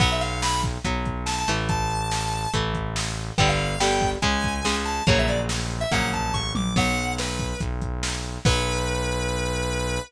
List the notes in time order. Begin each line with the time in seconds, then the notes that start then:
0.00 B1 F#3 B3 F#5, kick, crash
0.12 E5
0.21 F5, closed hi-hat
0.42 B5, snare
0.63 kick, closed hi-hat
0.85 B1 F#3 B3, kick, closed hi-hat
1.06 kick, closed hi-hat
1.26 A5, snare
1.38 A5
1.48 A1 E3 A3, closed hi-hat
1.69 A5, kick, closed hi-hat
1.90 closed hi-hat
2.11 snare
2.33 closed hi-hat
2.54 A1 E3 A3, kick, closed hi-hat
2.74 kick, closed hi-hat
2.96 snare
3.17 closed hi-hat
3.38 G1 D3 G3 B3 G5, kick, closed hi-hat
3.48 F5
3.59 closed hi-hat
3.80 D3 G3 B3 G5, snare
4.01 kick, closed hi-hat
4.22 C#2 C#3 G#3 G#5, kick, closed hi-hat
4.44 kick, closed hi-hat
4.65 C#3 G#3, snare
4.85 A5, closed hi-hat
5.07 A#1 C#3 F#3 A#3 C#5, kick, closed hi-hat
5.19 E5
5.28 D5, closed hi-hat
5.49 snare
5.71 closed hi-hat
5.81 E5
5.91 A#1 C#3 F#3 A#3 F#5, kick, closed hi-hat
6.13 A5, kick, closed hi-hat
6.34 A1 C#6, kick
6.55 A#1 D6, high tom
6.76 B1 F#3 B3 F#5, kick, crash
6.97 closed hi-hat
7.18 B4, snare
7.39 kick, closed hi-hat
7.60 B1, kick, closed hi-hat
7.82 kick, closed hi-hat
8.03 snare
8.24 closed hi-hat
8.45 B1 F#3 B3 B4, kick, crash